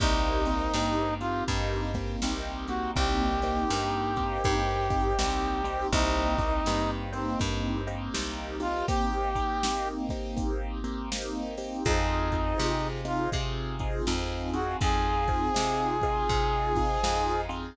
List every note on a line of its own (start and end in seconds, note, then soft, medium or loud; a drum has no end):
0.00 0.69 C2 loud
0.00 0.42 A#3 loud
0.00 0.42 C4 loud
0.00 0.42 D#4 loud
0.00 1.14 D#4 medium
0.00 0.42 G4 loud
0.00 kick loud
0.00 closed hi-hat loud
0.45 0.72 A#3 medium
0.45 0.72 C4 loud
0.45 0.72 D#4 loud
0.45 0.72 G4 loud
0.45 closed hi-hat medium
0.74 1.43 G2 medium
0.74 1.18 A#3 medium
0.74 1.18 C4 medium
0.74 1.18 D#4 medium
0.74 1.18 G4 loud
0.74 snare loud
1.20 1.46 A#3 medium
1.20 1.46 C4 medium
1.20 1.46 D#4 medium
1.20 1.44 F4 medium
1.20 1.46 G4 medium
1.20 closed hi-hat medium
1.48 2.17 G2 medium
1.48 1.91 A#3 medium
1.48 1.91 C4 medium
1.48 1.91 D#4 loud
1.48 1.91 G4 medium
1.48 kick medium
1.48 closed hi-hat loud
1.94 2.20 A#3 medium
1.94 2.20 C4 medium
1.94 2.20 D#4 medium
1.94 2.20 G4 medium
1.94 kick medium
1.94 closed hi-hat medium
2.22 2.91 C2 medium
2.22 2.66 A#3 medium
2.22 2.66 C4 medium
2.22 2.66 D#4 medium
2.22 2.66 G4 loud
2.22 snare loud
2.68 2.94 A#3 medium
2.68 2.94 C4 medium
2.68 2.94 D#4 medium
2.68 2.91 F#4 medium
2.68 2.94 G4 medium
2.68 closed hi-hat medium
2.96 3.65 C2 medium
2.96 3.39 A#3 loud
2.96 3.39 C4 loud
2.96 3.39 D#4 loud
2.96 3.39 G4 loud
2.96 5.87 G4 medium
2.96 kick loud
2.96 closed hi-hat loud
3.42 3.69 A#3 loud
3.42 3.69 C4 loud
3.42 3.69 D#4 loud
3.42 3.69 G4 medium
3.42 closed hi-hat medium
3.70 4.39 G2 medium
3.70 4.13 A#3 medium
3.70 4.13 C4 medium
3.70 4.13 D#4 loud
3.70 4.13 G4 medium
3.70 snare loud
4.16 4.42 A#3 medium
4.16 4.42 C4 medium
4.16 4.42 D#4 medium
4.16 4.42 G4 loud
4.16 kick medium
4.16 closed hi-hat medium
4.44 5.13 G2 medium
4.44 4.87 A#3 loud
4.44 4.87 C4 medium
4.44 4.87 D#4 medium
4.44 4.87 G4 loud
4.44 kick medium
4.44 closed hi-hat loud
4.90 5.16 A#3 medium
4.90 5.16 C4 medium
4.90 5.16 D#4 medium
4.90 5.16 G4 loud
4.90 kick medium
4.90 closed hi-hat medium
5.19 5.87 C2 medium
5.19 5.61 A#3 medium
5.19 5.61 C4 medium
5.19 5.61 D#4 loud
5.19 5.61 G4 medium
5.19 snare loud
5.64 5.90 A#3 medium
5.64 5.90 C4 loud
5.64 5.90 D#4 medium
5.64 5.90 G4 loud
5.64 closed hi-hat medium
5.92 6.61 C2 loud
5.92 6.36 A#3 loud
5.92 6.36 C4 loud
5.92 6.90 D#4 medium
5.92 6.36 D#4 loud
5.92 6.36 G4 loud
5.92 kick loud
5.92 closed hi-hat loud
6.38 6.64 A#3 medium
6.38 6.64 C4 medium
6.38 6.64 D#4 medium
6.38 6.64 G4 loud
6.38 kick loud
6.38 closed hi-hat medium
6.66 7.35 G2 medium
6.66 7.10 A#3 medium
6.66 7.10 C4 medium
6.66 7.10 D#4 loud
6.66 7.10 G4 medium
6.66 snare loud
7.13 7.38 A#3 medium
7.13 7.38 C4 medium
7.13 7.39 C4 medium
7.13 7.38 D#4 medium
7.13 7.38 G4 medium
7.13 closed hi-hat medium
7.39 8.09 G2 medium
7.39 7.82 A#3 medium
7.39 7.82 C4 loud
7.39 7.82 D#4 medium
7.39 7.82 G4 medium
7.39 kick medium
7.39 closed hi-hat loud
7.87 8.13 A#3 loud
7.87 8.13 C4 medium
7.87 8.13 D#4 medium
7.87 8.13 G4 medium
7.87 closed hi-hat medium
8.14 8.83 C2 medium
8.14 8.56 A#3 loud
8.14 8.56 C4 medium
8.14 8.56 D#4 loud
8.14 8.56 G4 medium
8.14 snare loud
8.60 8.85 A#3 medium
8.60 8.85 C4 medium
8.60 8.85 D#4 medium
8.60 8.86 F4 medium
8.60 8.85 G4 medium
8.60 closed hi-hat medium
8.88 9.31 A#3 loud
8.88 9.31 C4 loud
8.88 9.31 D#4 loud
8.88 9.88 G4 medium
8.88 9.31 G4 loud
8.88 kick loud
8.88 closed hi-hat loud
9.35 9.61 A#3 medium
9.35 9.61 C4 medium
9.35 9.61 D#4 loud
9.35 9.61 G4 loud
9.35 kick medium
9.35 closed hi-hat medium
9.63 10.07 A#3 loud
9.63 10.07 C4 medium
9.63 10.07 D#4 medium
9.63 10.07 G4 medium
9.63 snare loud
10.09 10.36 A#3 medium
10.09 10.36 C4 medium
10.09 10.36 D#4 loud
10.09 10.36 G4 medium
10.09 kick medium
10.09 closed hi-hat medium
10.37 10.79 A#3 medium
10.37 10.79 C4 medium
10.37 10.79 D#4 medium
10.37 10.79 G4 medium
10.37 kick medium
10.37 closed hi-hat loud
10.84 11.09 A#3 loud
10.84 11.09 C4 loud
10.84 11.09 D#4 medium
10.84 11.09 G4 medium
10.84 closed hi-hat medium
11.12 11.55 A#3 loud
11.12 11.55 C4 medium
11.12 11.55 D#4 loud
11.12 11.55 G4 medium
11.12 snare loud
11.58 11.83 A#3 medium
11.58 11.83 C4 medium
11.58 11.83 D#4 medium
11.58 11.83 G4 medium
11.58 open hi-hat medium
11.85 12.54 F2 loud
11.85 12.28 C4 loud
11.85 12.88 D#4 medium
11.85 12.28 D#4 loud
11.85 12.28 F4 loud
11.85 12.28 G#4 loud
11.85 kick loud
11.85 closed hi-hat loud
12.32 12.57 C4 medium
12.32 12.57 D#4 loud
12.32 12.57 F4 medium
12.32 12.57 G#4 medium
12.32 kick medium
12.32 closed hi-hat medium
12.58 13.28 C3 medium
12.58 13.00 C4 loud
12.58 13.00 D#4 medium
12.58 13.00 F4 loud
12.58 13.00 G#4 medium
12.58 snare loud
13.05 13.30 C4 medium
13.05 13.30 D#4 loud
13.05 13.30 F4 medium
13.05 13.30 G#4 medium
13.05 closed hi-hat medium
13.32 14.02 C3 medium
13.32 13.75 C4 loud
13.32 13.75 D#4 medium
13.32 13.75 F4 medium
13.32 13.75 G#4 loud
13.32 kick loud
13.32 closed hi-hat loud
13.79 14.06 C4 medium
13.79 14.06 D#4 medium
13.79 14.06 F4 medium
13.79 14.06 G#4 medium
13.79 kick medium
13.79 closed hi-hat medium
14.07 14.76 F2 medium
14.07 14.50 C4 medium
14.07 14.50 D#4 medium
14.07 14.50 F4 medium
14.07 14.50 G#4 loud
14.07 snare loud
14.53 14.79 C4 loud
14.53 14.79 D#4 medium
14.53 14.79 F4 medium
14.53 14.77 F#4 medium
14.53 14.79 G#4 medium
14.53 closed hi-hat medium
14.81 15.50 F2 medium
14.81 15.24 C4 loud
14.81 15.24 D#4 loud
14.81 15.24 F4 loud
14.81 15.24 G#4 loud
14.81 17.41 G#4 loud
14.81 kick loud
14.81 closed hi-hat loud
15.27 15.54 C4 loud
15.27 15.54 D#4 medium
15.27 15.54 F4 medium
15.27 15.54 G#4 medium
15.27 kick medium
15.27 closed hi-hat medium
15.54 16.25 C3 medium
15.54 15.97 C4 medium
15.54 15.97 D#4 medium
15.54 15.97 F4 medium
15.54 15.97 G#4 loud
15.54 snare loud
16.02 16.29 C4 medium
16.02 16.29 D#4 medium
16.02 16.29 F4 loud
16.02 16.29 G#4 medium
16.02 kick medium
16.02 closed hi-hat medium
16.29 16.98 C3 medium
16.29 16.73 C4 medium
16.29 16.73 D#4 medium
16.29 16.73 F4 loud
16.29 16.73 G#4 medium
16.29 kick medium
16.29 closed hi-hat loud
16.76 17.02 C4 medium
16.76 17.02 D#4 medium
16.76 17.02 F4 loud
16.76 17.02 G#4 loud
16.76 kick medium
16.76 closed hi-hat medium
17.03 17.72 F2 medium
17.03 17.46 C4 medium
17.03 17.46 D#4 loud
17.03 17.46 F4 loud
17.03 17.46 G#4 medium
17.03 snare loud
17.49 17.75 C4 medium
17.49 17.75 D#4 loud
17.49 17.75 F4 loud
17.49 17.75 G#4 medium
17.49 closed hi-hat medium